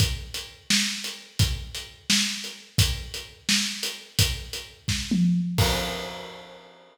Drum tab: CC |------------|------------|------------|------------|
HH |x--x-----x--|x--x-----x--|x--x-----x--|x--x--------|
SD |------o-----|------o-----|------o-----|------o-----|
T1 |------------|------------|------------|--------o---|
BD |o-----------|o-----------|o-----------|o-----o-----|

CC |x-----------|
HH |------------|
SD |------------|
T1 |------------|
BD |o-----------|